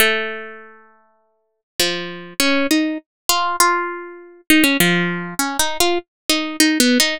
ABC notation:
X:1
M:6/4
L:1/16
Q:1/4=100
K:none
V:1 name="Orchestral Harp"
A,12 F,4 ^C2 ^D2 z2 F2 | F6 ^D ^C F,4 (3C2 D2 F2 z2 D2 (3D2 B,2 D2 |]